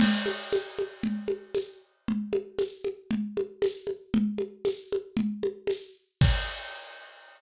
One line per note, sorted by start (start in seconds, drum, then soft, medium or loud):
0.00 crash loud
0.00 low conga loud
0.26 high conga medium
0.53 tambourine medium
0.53 high conga medium
0.79 high conga medium
1.03 low conga medium
1.28 high conga medium
1.55 tambourine medium
1.55 high conga medium
2.08 low conga medium
2.33 high conga medium
2.59 tambourine medium
2.59 high conga medium
2.84 high conga medium
3.11 low conga medium
3.37 high conga medium
3.62 tambourine medium
3.62 high conga loud
3.87 high conga medium
4.14 low conga loud
4.38 high conga medium
4.65 tambourine medium
4.65 high conga medium
4.92 high conga medium
5.17 low conga loud
5.43 high conga medium
5.67 tambourine medium
5.67 high conga medium
6.21 kick loud
6.21 crash loud